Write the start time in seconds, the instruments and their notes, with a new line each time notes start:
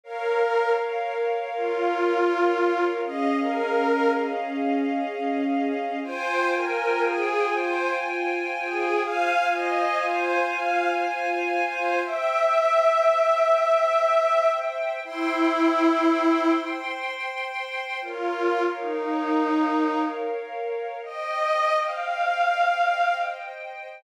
0.03 string ensemble 1 A#4 C#5 F5, pad 5 (bowed) A#4
0.98 pad 5 (bowed) A#4
1.53 pad 5 (bowed) F4
3.03 string ensemble 1 C#4 G#4 D#5 F5, pad 5 (bowed) D#5
3.40 pad 5 (bowed) A#4
6.03 string ensemble 1 F4 C5 G5 G#5, pad 5 (bowed) C5
6.55 pad 5 (bowed) A#4
7.05 pad 5 (bowed) G#4
7.55 pad 5 (bowed) C5
8.65 pad 5 (bowed) G#4
9.03 string ensemble 1 F4 C5 F5 G#5, pad 5 (bowed) F5
9.52 pad 5 (bowed) D#5
10.02 pad 5 (bowed) C5
10.54 pad 5 (bowed) F5
11.65 pad 5 (bowed) C5
12.03 string ensemble 1 C5 E5 G5, pad 5 (bowed) E5
15.03 pad 5 (bowed) E4, string ensemble 1 C5 G5 C6
18.01 pad 5 (bowed) F4, string ensemble 1 A#4 C#5 F5
18.77 pad 5 (bowed) D#4
21.03 string ensemble 1 C5 D#5 G5, pad 5 (bowed) D#5
21.81 pad 5 (bowed) F5